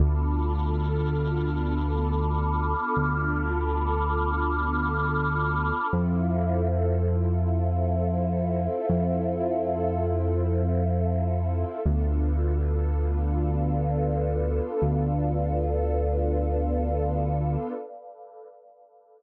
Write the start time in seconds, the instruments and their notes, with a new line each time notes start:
0.00 synth bass 1 D2, pad 2 (warm) B3 D4 F4 A4 A5 B5 D6 F6
2.97 synth bass 1 D2
5.92 synth bass 1 F2, pad 2 (warm) C4 E4 F4 A4 C5 E5 F5
8.89 synth bass 1 F2
11.85 synth bass 1 D2, pad 2 (warm) B3 D4 F4 A4 B4 D5 F5
14.82 synth bass 1 D2